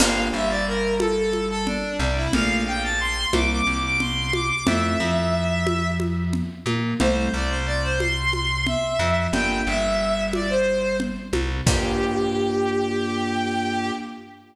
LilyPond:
<<
  \new Staff \with { instrumentName = "Violin" } { \time 7/8 \key g \dorian \tempo 4 = 90 f''8 e''16 d''16 bes'8 a'16 a'8 a'16 d'8 d'16 e'16 | f''8 g''16 a''16 c'''8 d'''16 d'''8 d'''16 c'''8 d'''16 d'''16 | e''2 r4. | c''16 c''16 d''16 c''16 d''16 c''16 c'''4 e''4 |
g''8 e''4 d''16 c''8. r4 | g'2.~ g'8 | }
  \new Staff \with { instrumentName = "Electric Piano 1" } { \time 7/8 \key g \dorian <bes d' f' g'>8 g2~ g8 c8 | <a bes d' f'>8 r4 <g bes c' e'>8 c4. | <a c' e' f'>8 f2~ f8 bes8 | <g a c' e'>8 c2~ c8 f8 |
<bes d' f' g'>8 g2~ g8 c8 | <bes d' f' g'>2.~ <bes d' f' g'>8 | }
  \new Staff \with { instrumentName = "Electric Bass (finger)" } { \clef bass \time 7/8 \key g \dorian g,,8 g,,2~ g,,8 c,8 | bes,,4. c,8 c,4. | f,8 f,2~ f,8 bes,8 | c,8 c,2~ c,8 f,8 |
g,,8 g,,2~ g,,8 c,8 | g,2.~ g,8 | }
  \new DrumStaff \with { instrumentName = "Drums" } \drummode { \time 7/8 <cgl cymc>4. cgho8 cgho8 cgl4 | cgl4. cgho4 cgl8 cgho8 | cgl4. cgho8 cgho8 cgl8 cgho8 | cgl4. cgho8 cgho8 cgl4 |
cgl4. cgho4 cgl8 cgho8 | <cymc bd>4. r4 r4 | }
>>